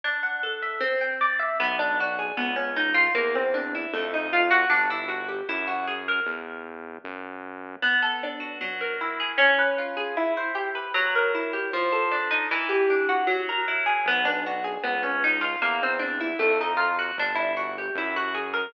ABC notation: X:1
M:4/4
L:1/8
Q:1/4=154
K:Em
V:1 name="Acoustic Guitar (steel)"
D f A e C g d e | [K:Bm] B, D F ^G B, C ^D ^E | _B, =C D E A, _E =F _G | D E F G E F ^G ^A |
z8 | B, A D F F, ^A E ^G | _D _c =F _A E =c G B | F, ^A E G =F, =A D _E |
E, G D F F, ^A E ^G | B, D F ^G B, C ^D ^E | _B, =C D E A, _E =F _G | D E F G E F ^G ^A |]
V:2 name="Synth Bass 1" clef=bass
z8 | [K:Bm] B,,,4 C,,4 | E,,4 =F,,4 | G,,,4 F,,4 |
E,,4 F,,4 | z8 | z8 | z8 |
z8 | B,,,4 C,,4 | E,,4 =F,,4 | G,,,4 F,,4 |]